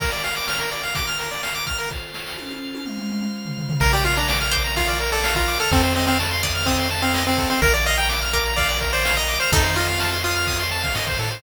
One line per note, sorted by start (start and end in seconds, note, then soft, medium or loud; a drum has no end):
0.00 0.11 A#4 medium
0.00 0.94 A#4 medium
0.00 0.94 D5 medium
0.00 0.94 F5 medium
0.00 kick medium
0.00 crash medium
0.12 0.23 D5 medium
0.12 closed hi-hat medium
0.24 0.35 F5 medium
0.24 closed hi-hat medium
0.36 0.47 D6 medium
0.36 closed hi-hat medium
0.48 0.59 F6 medium
0.48 snare medium
0.60 0.70 A#4 medium
0.60 closed hi-hat medium
0.71 0.82 D5 medium
0.71 closed hi-hat medium
0.83 0.94 F5 medium
0.83 closed hi-hat medium
0.95 1.90 A#4 medium
0.95 1.90 F5 medium
0.95 1.90 A#5 medium
0.95 1.06 D6 medium
0.95 kick medium
0.95 closed hi-hat medium
1.07 1.18 F6 medium
1.07 closed hi-hat medium
1.19 1.30 A#4 medium
1.19 closed hi-hat medium
1.31 1.42 D5 medium
1.31 closed hi-hat medium
1.43 1.54 F5 medium
1.43 snare medium
1.55 1.65 D6 medium
1.55 closed hi-hat medium
1.66 1.77 F6 medium
1.66 kick medium
1.66 closed hi-hat medium
1.78 1.89 A#4 medium
1.78 closed hi-hat medium
1.90 2.85 F4 medium
1.90 2.85 A4 medium
1.90 2.85 C5 medium
1.90 kick medium
1.90 snare medium
2.14 snare medium
2.26 snare medium
2.38 high tom medium
2.50 high tom medium
2.75 high tom medium
2.85 3.80 F4 medium
2.85 3.80 C5 medium
2.85 3.80 F5 medium
2.85 mid tom medium
2.98 mid tom medium
3.10 mid tom medium
3.21 mid tom medium
3.45 floor tom medium
3.58 floor tom medium
3.69 floor tom loud
3.80 5.56 A#1 medium
3.80 3.92 A#4 medium
3.80 5.69 A#4 medium
3.80 5.69 D5 medium
3.80 5.69 F5 medium
3.80 kick medium
3.80 crash medium
3.93 4.04 G4 medium
3.93 4.04 D5 medium
3.93 ride medium
4.04 4.16 F4 medium
4.04 4.15 F5 medium
4.04 ride medium
4.16 4.28 D4 medium
4.16 4.27 A#5 medium
4.16 ride medium
4.28 4.39 D6 medium
4.28 snare loud
4.40 4.51 F6 medium
4.40 ride medium
4.51 4.73 C5 medium
4.51 4.63 D6 medium
4.51 kick medium
4.51 ride medium
4.64 4.75 A#5 medium
4.64 ride medium
4.76 4.98 F4 medium
4.76 4.87 F5 medium
4.76 kick medium
4.76 ride medium
4.88 4.99 D5 medium
4.88 ride medium
5.00 5.11 A#4 medium
5.00 ride medium
5.12 5.34 A4 medium
5.12 5.23 D5 medium
5.12 ride medium
5.24 5.35 F5 medium
5.24 snare loud
5.35 5.58 F4 medium
5.35 5.47 A#5 medium
5.35 kick medium
5.35 ride medium
5.48 5.58 D6 medium
5.48 ride medium
5.59 5.71 A4 medium
5.59 5.70 F6 medium
5.59 ride medium
5.71 7.47 F2 loud
5.71 5.82 C4 medium
5.71 7.60 A4 medium
5.71 5.82 A4 medium
5.71 7.60 C5 medium
5.71 7.60 D#5 medium
5.71 7.60 F5 medium
5.71 kick loud
5.71 ride medium
5.83 5.94 C4 medium
5.83 5.94 C5 medium
5.83 ride medium
5.95 6.06 C4 medium
5.95 6.06 D#5 medium
5.95 ride medium
6.07 6.18 C4 medium
6.07 6.18 F5 medium
6.07 ride medium
6.19 6.30 A5 medium
6.19 snare medium
6.31 6.42 C6 medium
6.31 ride medium
6.43 6.64 D5 medium
6.43 6.54 D#6 medium
6.43 kick medium
6.43 ride medium
6.55 6.66 F6 medium
6.55 ride medium
6.66 6.88 C4 medium
6.66 6.77 D#6 medium
6.66 kick medium
6.66 ride medium
6.78 6.89 C6 medium
6.78 ride medium
6.90 7.01 A5 medium
6.90 ride medium
7.02 7.24 C4 medium
7.02 7.13 F5 medium
7.02 ride soft
7.14 7.25 D#5 medium
7.14 snare medium
7.26 7.49 C4 medium
7.26 7.37 C5 medium
7.26 ride medium
7.37 7.49 A4 medium
7.37 kick medium
7.37 ride medium
7.50 7.61 C4 medium
7.50 7.61 C5 medium
7.50 ride medium
7.62 9.37 A#1 medium
7.62 7.73 A#4 medium
7.62 9.50 A#4 medium
7.62 7.73 A#4 medium
7.62 9.50 D5 medium
7.62 9.50 F5 medium
7.62 kick loud
7.62 ride medium
7.74 7.85 D5 medium
7.74 7.84 D5 medium
7.74 ride medium
7.85 7.98 D#5 medium
7.85 7.97 F5 medium
7.85 ride medium
7.97 8.09 G5 medium
7.97 8.08 A#5 medium
7.97 ride medium
8.09 8.20 D6 medium
8.09 snare medium
8.22 8.32 F6 medium
8.22 ride medium
8.33 8.53 A#4 medium
8.33 8.44 D6 medium
8.33 kick medium
8.33 ride medium
8.44 8.56 A#5 medium
8.44 ride medium
8.56 8.78 D5 medium
8.56 8.68 F5 medium
8.56 kick medium
8.56 ride medium
8.68 8.80 D5 medium
8.68 ride medium
8.81 8.92 A#4 medium
8.81 kick medium
8.81 ride medium
8.92 9.16 C5 medium
8.92 9.04 D5 medium
8.92 ride medium
9.05 9.15 F5 medium
9.05 snare loud
9.17 9.38 D#5 medium
9.17 9.27 A#5 medium
9.17 ride medium
9.28 9.39 D6 medium
9.28 ride medium
9.40 9.51 C5 medium
9.40 9.51 F6 medium
9.40 ride medium
9.52 10.88 F2 medium
9.52 10.64 D#4 medium
9.52 9.76 D#4 medium
9.52 9.63 A4 medium
9.52 11.41 A4 medium
9.52 11.41 C5 medium
9.52 11.41 D#5 medium
9.52 11.41 F5 medium
9.52 kick loud
9.52 ride medium
9.64 9.75 C5 medium
9.64 ride medium
9.76 10.17 F4 medium
9.76 9.87 D#5 medium
9.76 ride medium
9.88 9.99 F5 medium
9.88 ride medium
9.99 10.11 A5 medium
9.99 snare medium
10.11 10.23 C6 medium
10.11 ride medium
10.23 10.63 F4 medium
10.23 10.35 D#6 medium
10.23 ride medium
10.36 10.46 F6 medium
10.36 ride medium
10.47 10.58 D#6 medium
10.47 kick medium
10.47 ride medium
10.59 10.70 C6 medium
10.59 ride medium
10.71 10.82 A5 medium
10.71 ride medium
10.83 10.94 F5 medium
10.83 kick medium
10.83 ride medium
10.95 11.17 G#2 medium
10.95 11.06 D#5 medium
10.95 snare medium
11.07 11.18 C5 medium
11.07 kick medium
11.07 ride medium
11.19 11.41 A2 medium
11.19 11.30 A4 medium
11.19 ride medium
11.31 11.42 C5 medium
11.31 ride medium